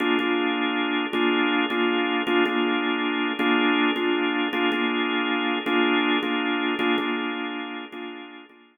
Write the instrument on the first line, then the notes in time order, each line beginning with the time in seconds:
drawbar organ
0.00 A#3 D4 F4 G#4
0.19 A#3 D4 F4 G#4
1.13 A#3 D4 F4 G#4
1.70 A#3 D4 F4 G#4
2.27 A#3 D4 F4 G#4
2.46 A#3 D4 F4 G#4
3.39 A#3 D4 F4 G#4
3.96 A#3 D4 F4 G#4
4.53 A#3 D4 F4 G#4
4.72 A#3 D4 F4 G#4
5.66 A#3 D4 F4 G#4
6.23 A#3 D4 F4 G#4
6.79 A#3 D4 F4 G#4
6.98 A#3 D4 F4 G#4
7.92 A#3 D4 F4 G#4
8.49 A#3 D4 F4 G#4